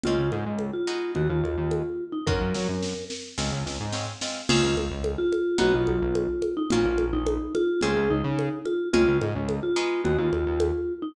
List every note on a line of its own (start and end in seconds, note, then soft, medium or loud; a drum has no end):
0.03 0.17 C#2 medium
0.03 0.45 G#3 medium
0.03 0.45 C4 medium
0.03 0.45 C#4 medium
0.03 0.29 F4 loud
0.03 0.45 F4 medium
0.03 low conga medium
0.19 0.31 C#2 medium
0.32 0.45 G#2 medium
0.32 high conga medium
0.46 0.71 C#2 medium
0.59 high conga medium
0.73 1.12 F4 medium
0.87 1.54 G#3 loud
0.87 1.54 B3 loud
0.87 1.54 D#4 medium
0.87 1.54 F#4 medium
1.15 1.28 D#2 medium
1.15 1.29 F#4 medium
1.15 low conga medium
1.29 1.42 D#2 medium
1.29 2.04 F4 medium
1.44 1.56 D#2 medium
1.44 high conga medium
1.58 1.83 D#2 medium
1.71 high conga medium
2.12 2.26 D#4 medium
2.27 2.39 F#2 loud
2.27 2.66 A#3 loud
2.27 2.66 C#4 loud
2.27 2.66 F4 medium
2.27 2.66 F#4 loud
2.27 3.05 A#4 medium
2.27 kick medium
2.41 2.53 F#2 medium
2.54 2.67 F#3 medium
2.54 snare medium
2.69 2.94 F#2 medium
2.83 snare medium
3.10 snare medium
3.38 3.50 C#2 loud
3.38 3.77 G#3 loud
3.38 3.77 C4 loud
3.38 3.77 C#4 loud
3.38 3.77 F4 loud
3.38 snare medium
3.52 3.64 C#2 medium
3.66 3.78 C#2 medium
3.66 snare medium
3.80 4.05 G#2 medium
3.92 4.12 G#3 medium
3.92 4.12 C4 medium
3.92 4.12 C#4 medium
3.92 4.12 F4 medium
3.92 snare medium
4.21 4.41 G#3 medium
4.21 4.41 C4 medium
4.21 4.41 C#4 medium
4.21 4.41 F4 medium
4.21 snare medium
4.49 4.61 C#2 loud
4.49 4.88 C4 loud
4.49 4.88 C#4 loud
4.49 4.76 F4 loud
4.49 4.88 F4 loud
4.49 4.88 G#4 loud
4.49 crash loud
4.49 low conga loud
4.63 4.76 C#2 loud
4.77 4.89 C#2 loud
4.77 high conga medium
4.91 5.16 C#2 loud
5.04 high conga medium
5.18 5.57 F4 loud
5.32 high conga medium
5.58 5.73 B1 loud
5.58 5.97 B3 loud
5.58 5.97 D#4 loud
5.58 5.97 F#4 loud
5.58 5.73 F#4 loud
5.58 5.97 G#4 loud
5.58 low conga loud
5.74 5.87 B1 medium
5.74 6.54 F4 medium
5.87 6.00 B1 loud
5.87 high conga medium
6.02 6.27 B1 loud
6.15 high conga medium
6.42 high conga medium
6.57 6.70 D#4 loud
6.70 6.84 A#1 loud
6.70 7.11 A#3 loud
6.70 7.11 C#4 loud
6.70 7.05 F4 loud
6.70 7.11 F4 loud
6.70 7.11 F#4 loud
6.70 low conga loud
6.85 6.98 A#1 loud
6.98 7.12 A#1 medium
6.98 high conga medium
7.13 7.38 A#1 loud
7.13 7.53 D#4 medium
7.27 high conga loud
7.55 7.80 F4 loud
7.55 high conga medium
7.81 7.95 C#2 loud
7.81 8.21 G#3 loud
7.81 8.21 C4 loud
7.81 8.21 C#4 loud
7.81 8.21 F4 loud
7.81 8.08 G#4 loud
7.81 low conga medium
7.96 8.09 C#2 loud
8.10 8.23 C#2 loud
8.10 8.59 D#4 loud
8.24 8.49 C#3 loud
8.39 high conga medium
8.65 8.88 F4 medium
8.65 high conga medium
8.93 9.06 C#2 loud
8.93 9.32 G#3 loud
8.93 9.32 C4 loud
8.93 9.32 C#4 loud
8.93 9.18 F4 loud
8.93 9.32 F4 loud
8.93 low conga loud
9.08 9.20 C#2 loud
9.21 9.34 G#2 loud
9.21 high conga medium
9.35 9.60 C#2 loud
9.49 high conga medium
9.63 10.01 F4 medium
9.76 10.43 G#3 loud
9.76 10.43 B3 loud
9.76 10.43 D#4 loud
9.76 10.43 F#4 loud
10.04 10.17 D#2 loud
10.04 10.18 F#4 medium
10.04 low conga medium
10.18 10.31 D#2 loud
10.18 10.93 F4 medium
10.32 10.45 D#2 loud
10.32 high conga medium
10.46 10.71 D#2 loud
10.60 high conga loud
11.02 11.15 D#4 loud